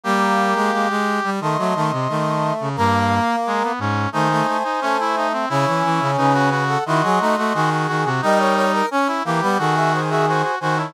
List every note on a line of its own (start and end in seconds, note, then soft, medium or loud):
0.04 0.54 G3 loud
0.04 0.87 A#3 loud
0.04 1.30 G4 medium
0.55 0.71 G#3 loud
0.72 0.88 G#3 medium
0.89 1.20 G#3 loud
1.24 1.40 G3 loud
1.40 1.57 D#3 medium
1.40 1.58 A3 loud
1.40 2.54 D#5 medium
1.40 2.54 C6 medium
1.58 1.74 F#3 loud
1.58 1.74 A3 medium
1.75 1.91 D#3 loud
1.75 1.92 A3 loud
1.91 2.08 C3 loud
2.09 2.52 D#3 medium
2.09 2.69 A3 loud
2.60 2.76 C#3 medium
2.76 3.20 G2 loud
2.76 3.72 A#3 loud
2.76 3.36 A#3 medium
3.47 3.63 G#3 medium
3.63 3.80 B3 medium
3.79 4.07 G#2 loud
3.79 4.09 C#4 medium
4.12 4.42 D#3 loud
4.12 4.28 A3 loud
4.12 4.57 D#4 medium
4.12 5.27 C5 medium
4.12 5.27 G#5 medium
4.31 4.47 A3 loud
4.47 4.63 A3 medium
4.64 4.80 D#4 medium
4.81 5.46 A3 loud
4.81 4.97 C#4 medium
5.00 5.16 E4 medium
5.16 5.33 D#4 medium
5.33 5.49 C4 medium
5.49 5.66 C#3 loud
5.49 6.50 C#4 loud
5.49 6.11 E4 medium
5.67 5.83 E3 medium
5.84 6.00 E3 loud
6.00 6.17 C#3 loud
6.17 6.77 C#3 loud
6.17 6.33 D#4 medium
6.17 6.64 B4 medium
6.17 6.64 G#5 medium
6.33 6.50 F#4 medium
6.50 6.78 F#4 medium
6.68 6.84 A4 medium
6.68 6.84 F#5 medium
6.86 7.02 D#3 loud
6.86 7.02 E4 medium
6.86 7.35 F#4 medium
6.86 7.69 D#5 medium
6.86 7.69 C6 medium
7.03 7.19 F#3 loud
7.03 7.19 G#4 loud
7.20 7.36 A3 loud
7.20 7.37 D#4 loud
7.37 7.53 A3 loud
7.37 7.53 F#4 medium
7.54 7.87 D#3 loud
7.54 7.70 F#4 medium
7.54 8.09 G#4 loud
7.70 7.87 F#4 medium
7.87 8.05 D#3 loud
7.87 8.03 F#4 medium
8.05 8.21 C3 loud
8.05 8.21 F#4 medium
8.21 8.82 G3 loud
8.21 8.86 D#4 medium
8.21 8.65 A#4 medium
8.21 8.39 D#5 loud
8.21 8.65 G5 medium
8.38 8.55 C#5 medium
8.56 8.72 C#5 loud
8.73 8.89 A#4 loud
8.91 9.22 C#4 loud
8.91 9.08 C#4 medium
9.07 9.23 E4 medium
9.24 9.41 E3 loud
9.24 9.40 A#3 loud
9.24 9.58 G4 medium
9.41 9.58 G3 loud
9.41 9.58 B3 loud
9.58 10.43 D#3 loud
9.58 10.01 F#4 medium
9.58 10.51 G#4 loud
9.58 9.75 A4 medium
9.58 9.75 F#5 medium
9.76 9.92 G#4 medium
9.76 9.92 E5 medium
9.93 10.10 C5 medium
9.93 10.10 G#5 medium
10.10 10.26 F#4 medium
10.10 10.26 G#4 medium
10.10 10.26 E5 medium
10.28 10.42 F#4 medium
10.28 10.55 C5 medium
10.28 10.55 G#5 medium
10.43 10.59 F#4 medium
10.60 10.92 D#3 loud
10.60 10.78 F#4 medium
10.60 10.76 C5 medium
10.60 10.76 G#5 medium
10.77 10.93 E4 medium
10.77 10.93 C#5 medium
10.77 10.93 A5 medium